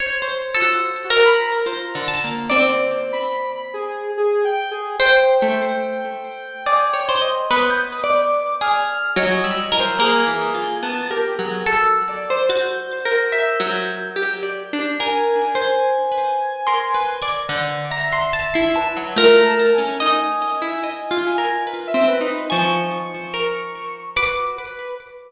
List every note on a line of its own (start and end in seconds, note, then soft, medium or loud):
0.00 0.25 C5 medium
0.00 0.50 C#5 medium
0.22 0.60 C5 medium
0.22 0.51 C5 medium
0.55 0.81 F4 medium
0.55 1.05 A4 loud
0.62 1.56 F#4 medium
1.04 1.23 F#4 medium
1.10 1.60 A#4 medium
1.25 1.44 B5 loud
1.47 2.41 A#5 medium
1.66 1.91 F4 medium
1.66 2.04 C5 soft
1.95 2.20 D3 medium
2.08 2.45 A5 loud
2.24 2.49 A#3 medium
2.49 4.01 C4 loud
2.49 3.06 C5 medium
2.49 4.75 D5 loud
3.12 3.50 B5 loud
3.55 3.74 B5 medium
3.74 4.11 G#4 medium
4.17 4.42 G#4 loud
4.45 4.70 G5 loud
4.71 4.96 G#4 loud
5.00 5.37 C5 loud
5.00 6.50 G5 loud
5.00 7.25 G5 medium
5.42 6.55 A3 medium
6.66 6.91 G#4 medium
6.66 7.04 D5 medium
6.94 7.19 C#5 medium
7.09 7.46 C5 medium
7.22 7.47 D#5 medium
7.50 8.01 B3 medium
7.50 7.69 B4 medium
7.50 8.00 D#6 medium
7.70 9.02 G6 medium
8.04 8.54 D5 loud
8.04 8.56 D6 medium
8.61 9.11 G#4 loud
8.61 9.12 F6 medium
9.16 9.41 F#3 loud
9.16 9.42 C#5 medium
9.16 9.74 D#5 medium
9.44 9.70 G3 medium
9.44 9.69 E6 medium
9.72 9.98 E3 soft
9.72 9.97 A#4 medium
9.79 9.98 C5 loud
9.99 10.24 A#3 medium
9.99 10.75 G#4 loud
9.99 11.50 A#4 loud
10.27 10.52 E3 medium
10.55 10.80 F4 medium
10.83 11.08 B3 medium
10.83 11.08 A5 loud
11.10 11.35 G4 medium
11.10 11.36 A#4 medium
11.39 11.64 F#3 medium
11.39 11.64 G#4 medium
11.65 12.02 F#4 medium
11.65 12.41 A4 medium
12.09 12.46 D5 medium
12.30 12.49 C5 loud
12.49 12.99 F#4 medium
12.49 14.75 G6 medium
12.49 13.25 A6 medium
13.05 13.55 A#4 loud
13.32 14.07 E5 medium
13.60 14.10 F#3 loud
14.16 14.41 G4 medium
14.43 14.68 D5 soft
14.73 14.98 D4 medium
14.99 16.50 A#4 medium
14.99 15.51 A#4 medium
14.99 17.24 G#5 medium
15.55 16.05 C5 loud
16.12 16.62 B4 medium
16.67 16.93 A#4 medium
16.67 16.92 C6 medium
16.94 17.19 B4 medium
16.94 17.21 C6 soft
17.22 17.47 D5 loud
17.22 17.47 G#6 medium
17.49 18.24 D3 loud
17.49 17.88 G6 medium
17.90 18.65 E5 medium
17.90 18.10 A#5 loud
18.12 18.31 C6 medium
18.33 18.52 A5 medium
18.54 18.93 E4 medium
18.54 18.73 C6 medium
18.76 19.14 B4 medium
18.76 19.13 A5 medium
18.97 19.15 F#3 medium
19.16 19.73 A3 loud
19.16 19.41 F4 loud
19.16 19.93 A#4 loud
19.46 19.71 A5 medium
19.74 19.97 C#4 medium
19.74 19.99 G#5 medium
20.00 20.20 D#4 medium
20.00 22.25 D#5 loud
20.00 21.14 G#5 medium
20.62 20.81 E4 medium
20.84 21.09 D#5 medium
21.11 21.36 F4 loud
21.26 21.64 G#5 medium
21.38 21.63 A#4 medium
21.67 21.92 B4 soft
21.87 22.06 E5 loud
21.94 22.19 C4 medium
22.08 22.45 B4 medium
22.21 22.46 D#4 medium
22.50 22.89 F3 medium
22.50 23.25 G#5 medium
22.50 24.00 C#6 medium
23.34 24.09 A#4 soft
24.16 24.55 F#4 medium
24.16 24.91 B4 medium
24.16 24.92 D6 medium
24.57 24.95 B4 medium